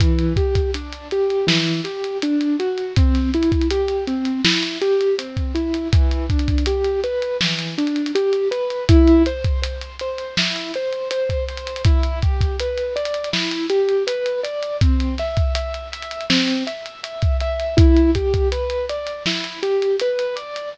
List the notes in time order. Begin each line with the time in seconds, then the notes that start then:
0.00 E3, kick, closed hi-hat
0.19 closed hi-hat
0.36 G4, kick, closed hi-hat
0.55 kick, closed hi-hat
0.74 D4, closed hi-hat
0.93 closed hi-hat
1.11 G4, closed hi-hat
1.30 closed hi-hat
1.47 E3, snare
1.67 closed hi-hat
1.84 G4, closed hi-hat
2.04 closed hi-hat
2.22 D4, closed hi-hat
2.41 closed hi-hat
2.60 F#4, closed hi-hat
2.78 closed hi-hat
2.96 C4, kick, closed hi-hat
3.15 snare, closed hi-hat
3.34 E4, closed hi-hat
3.43 closed hi-hat
3.52 kick, closed hi-hat
3.61 closed hi-hat
3.71 G4, closed hi-hat
3.88 closed hi-hat
4.07 C4, closed hi-hat
4.25 closed hi-hat
4.45 E4, snare
4.63 closed hi-hat
4.81 G4, closed hi-hat
5.01 closed hi-hat
5.18 C4, closed hi-hat
5.37 kick, closed hi-hat
5.55 E4, closed hi-hat
5.74 closed hi-hat
5.92 E3, kick, closed hi-hat
6.11 closed hi-hat
6.30 D4, kick, closed hi-hat
6.39 closed hi-hat
6.48 kick, closed hi-hat
6.58 closed hi-hat
6.66 G4, closed hi-hat
6.84 closed hi-hat
7.04 B4, closed hi-hat
7.22 closed hi-hat
7.41 E3, snare
7.59 closed hi-hat
7.78 D4, closed hi-hat
7.87 closed hi-hat
7.96 closed hi-hat
8.06 closed hi-hat
8.15 G4, closed hi-hat
8.33 closed hi-hat
8.51 B4, closed hi-hat
8.70 closed hi-hat
8.89 E4, kick, closed hi-hat
9.08 closed hi-hat
9.26 C5, closed hi-hat
9.44 kick, closed hi-hat
9.62 C5, closed hi-hat
9.81 closed hi-hat
9.99 C5, closed hi-hat
10.18 closed hi-hat
10.37 E4, snare
10.56 closed hi-hat
10.74 C5, closed hi-hat
10.93 closed hi-hat
11.11 C5, closed hi-hat
11.29 kick, closed hi-hat
11.48 C5, closed hi-hat
11.57 closed hi-hat
11.67 closed hi-hat
11.76 closed hi-hat
11.85 E4, kick, closed hi-hat
12.03 closed hi-hat
12.22 G4, kick, closed hi-hat
12.41 kick, closed hi-hat
12.60 B4, closed hi-hat
12.78 closed hi-hat
12.96 D5, closed hi-hat
13.05 closed hi-hat
13.14 closed hi-hat
13.24 closed hi-hat
13.33 E4, snare
13.51 closed hi-hat
13.70 G4, closed hi-hat
13.89 closed hi-hat
14.07 B4, closed hi-hat
14.26 closed hi-hat
14.43 D5, closed hi-hat
14.63 closed hi-hat
14.81 C4, kick, closed hi-hat
15.00 closed hi-hat
15.18 E5, snare, closed hi-hat
15.37 kick, closed hi-hat
15.55 E5, closed hi-hat
15.74 closed hi-hat
15.92 E5, closed hi-hat
16.02 closed hi-hat
16.11 closed hi-hat
16.21 closed hi-hat
16.30 C4, snare
16.48 closed hi-hat
16.67 E5, closed hi-hat
16.86 closed hi-hat
17.03 E5, closed hi-hat
17.22 kick, closed hi-hat
17.40 E5, closed hi-hat
17.60 closed hi-hat
17.77 E4, kick, closed hi-hat
17.97 closed hi-hat
18.15 G4, kick, closed hi-hat
18.34 kick, closed hi-hat
18.52 B4, closed hi-hat
18.70 closed hi-hat
18.90 D5, closed hi-hat
19.07 closed hi-hat
19.26 E4, snare
19.44 closed hi-hat
19.63 G4, closed hi-hat
19.82 closed hi-hat
20.00 B4, closed hi-hat
20.19 closed hi-hat
20.36 D5, closed hi-hat
20.56 closed hi-hat